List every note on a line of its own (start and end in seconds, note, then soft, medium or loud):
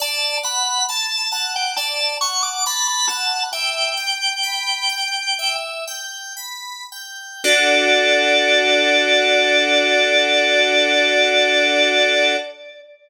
0.00 0.39 D5 medium
0.00 0.37 A5 loud
0.43 0.83 F#5 medium
0.43 0.86 B5 loud
0.89 1.28 A5 medium
0.89 1.32 A5 loud
1.32 1.71 F#5 medium
1.32 1.53 A5 medium
1.56 1.77 G5 medium
1.76 2.17 D5 medium
1.76 2.17 A5 medium
2.21 2.61 F#5 medium
2.21 2.42 C#6 loud
2.43 2.64 D6 loud
2.66 3.06 A5 medium
2.66 2.87 B5 medium
2.88 3.09 B5 loud
3.08 3.49 F#5 medium
3.08 3.43 A5 loud
3.53 3.93 E5 medium
3.53 5.55 G5 loud
3.97 4.38 G5 medium
4.43 4.85 B5 medium
4.89 5.33 G5 medium
5.39 5.83 E5 medium
5.87 6.33 G5 medium
6.37 6.83 B5 medium
6.92 7.40 G5 medium
7.44 12.36 D4 loud
7.44 12.36 F#4 loud
7.44 12.36 A4 loud
7.44 12.36 D5 loud